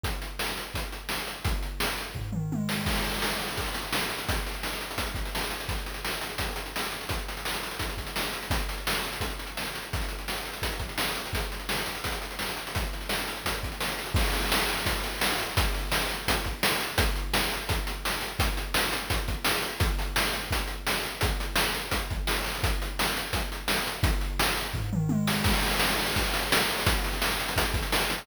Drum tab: CC |----------------|----------------|x---------------|----------------|
HH |x-x---x-x-x---x-|x-x---x---------|-xxx-xxxxxxx-xxx|xxxx-xxxxxxx-xxx|
SD |----o-------o---|----o---------o-|----o-------o---|----o-------o---|
T1 |----------------|------------o---|----------------|----------------|
T2 |----------------|----------o-----|----------------|----------------|
FT |----------------|--------o-------|----------------|----------------|
BD |o-------o-------|o-------o-------|o-------o-------|o-------o-o-----|

CC |----------------|----------------|----------------|----------------|
HH |xxxx-xxxxxxx-xxx|xxxx-xxxxxxx-xxx|xxxx-xxxxxxx-xxx|xxxx-xxxxxxx-xxx|
SD |----o-------o---|----o-------o---|----o-------o---|----o-------o---|
T1 |----------------|----------------|----------------|----------------|
T2 |----------------|----------------|----------------|----------------|
FT |----------------|----------------|----------------|----------------|
BD |o-------o-------|o-------o-o-----|o-------o-------|o-------o-o-----|

CC |----------------|----------------|x---------------|----------------|
HH |xxxx-xxxxxxx-xxx|xxxx-xxxxxxx-xxx|--x---x-x-x---x-|x-x---x-x-x---x-|
SD |----o-------o---|----o-------o---|----o-------o---|----o-------o---|
T1 |----------------|----------------|----------------|----------------|
T2 |----------------|----------------|----------------|----------------|
FT |----------------|----------------|----------------|----------------|
BD |o-------o-------|o-------o-o-----|o-------o-------|o-------o-o-----|

CC |----------------|----------------|----------------|----------------|
HH |x-x---x-x-x---x-|x-x---x-x-x---x-|x-x---x-x-x---x-|x-x---x-x-x---o-|
SD |----o-------o---|----o-------o---|----o-------o---|----o-------o---|
T1 |----------------|----------------|----------------|----------------|
T2 |----------------|----------------|----------------|----------------|
FT |----------------|----------------|----------------|----------------|
BD |o-------o-------|o-------o-o-----|o-------o-------|o-------o-o-----|

CC |----------------|----------------|x---------------|----------------|
HH |x-x---x-x-x---x-|x-x---x---------|-xxx-xxxxxxx-xxx|xxxx-xxxxxxx-xxx|
SD |----o-------o---|----o---------o-|----o-------o---|----o-------o---|
T1 |----------------|------------o---|----------------|----------------|
T2 |----------------|----------o-----|----------------|----------------|
FT |----------------|--------o-------|----------------|----------------|
BD |o-------o-------|o-------o-------|o-------o-------|o-------o-o-----|